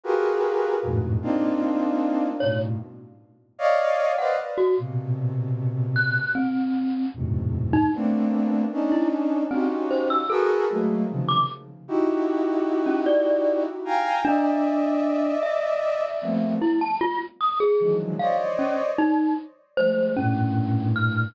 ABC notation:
X:1
M:6/8
L:1/16
Q:3/8=51
K:none
V:1 name="Flute"
[F^FG^G^AB]4 [=F,,=G,,^G,,=A,,^A,,B,,]2 [^A,CD^D=F]6 | [G,,A,,B,,]2 z4 [^cd^df]3 [B=c=d^df] z2 | [^A,,B,,C,]8 z4 | [E,,^F,,^G,,A,,B,,C,]4 [A,^A,B,CD]4 [^CD^D]4 |
[^C^DF^FG]4 [F^GA^AB]2 [^F,^G,=A,^A,]2 [=C,^C,^D,=F,]2 z2 | [^DE^FG]10 [=fg^g^a]2 | [d^de]10 [F,G,A,^A,B,C]2 | z6 [D,^D,E,F,^F,^G,]2 [c^c=d^d]4 |
z4 [F,G,^G,A,]2 [=G,,A,,^A,,]6 |]
V:2 name="Glockenspiel"
z12 | ^c z8 ^f z ^F | z6 ^f'2 C4 | z3 ^D z5 E z2 |
C z c e' A z4 d' z2 | z5 ^C d3 z3 | D6 e6 | E a F z ^d' ^G2 z f z ^C z |
^D2 z2 c2 ^C4 f'2 |]